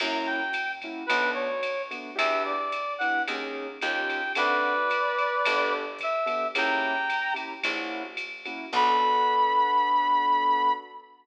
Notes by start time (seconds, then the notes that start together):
0.00 F#2 A#3 C#4 E4 F#4 A#5, kick, crash, ride
0.26 G5
0.53 hi-hat pedal, ride
0.82 A#3 C#4 E4 F#4, kick, ride
1.06 B1 A3 B3 D4 F#4 B4, kick, ride
1.34 C#5
1.63 hi-hat pedal, ride
1.91 A3 B3 D4 F#4, ride
2.16 E2 B3 D4 E4 G4 E5, kick, ride
2.45 D5
2.72 hi-hat pedal, ride
2.98 B3 D4 E4 G4 F#5, ride
3.28 D#2 A#3 C#4 D#4 G#4, ride
3.81 D#2 C#4 D#4 F4 G4 G5, hi-hat pedal, ride
4.10 ride
4.35 D2 C4 D4 F#4 A4 B4 D5, ride
4.90 hi-hat pedal, ride
5.18 ride
5.45 G1 B3 D4 G4 A4, kick, ride
5.99 kick, hi-hat pedal, ride
6.03 E5
6.26 B3 D4 G4 A4, ride
6.55 C#2 A#3 C#4 E4 G4 G5 A#5, ride
7.09 kick, hi-hat pedal, ride
7.34 A#3 C#4 E4 G4, ride
7.64 A#1 A#3 C#4 E4 F#4, kick, ride
8.17 hi-hat pedal, ride
8.45 A#3 C#4 E4 F#4, ride
8.73 B1 B3 D4 F#4 A4 B5, kick, crash